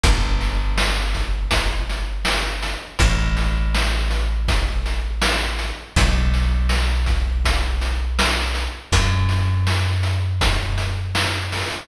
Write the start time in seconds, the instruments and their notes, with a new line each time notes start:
0.04 electric bass (finger) G1, kick, closed hi-hat
0.41 snare, closed hi-hat
0.78 snare
1.14 kick, closed hi-hat
1.51 kick, closed hi-hat
1.90 closed hi-hat
2.25 snare
2.63 closed hi-hat
2.99 electric bass (finger) A1, kick, closed hi-hat
3.37 snare, closed hi-hat
3.75 snare
4.11 closed hi-hat
4.48 kick, closed hi-hat
4.86 closed hi-hat
5.22 snare
5.59 closed hi-hat
5.96 electric bass (finger) B1, kick, closed hi-hat
6.34 snare, closed hi-hat
6.69 snare
7.06 kick, closed hi-hat
7.45 kick, closed hi-hat
7.81 closed hi-hat
8.19 snare
8.55 closed hi-hat
8.92 electric bass (finger) F#2, kick, closed hi-hat
9.29 snare, closed hi-hat
9.67 snare
10.03 closed hi-hat
10.41 kick, closed hi-hat
10.78 closed hi-hat
11.15 snare
11.52 open hi-hat